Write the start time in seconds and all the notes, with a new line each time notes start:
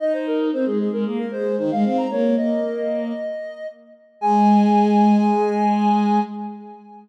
0.00 D#4 D#5
0.13 C5
0.26 A#4
0.52 C4 C5
0.66 G#3 G#4
0.79 G#4
0.92 G#3 A#4
1.05 A#3 G#4
1.19 A#4
1.31 G#3 C5
1.58 D#3 C5
1.71 G#3 F5
1.84 C4
1.97 A#5
2.11 A#3 C#5
2.37 A#3 D#5
4.21 G#3 G#5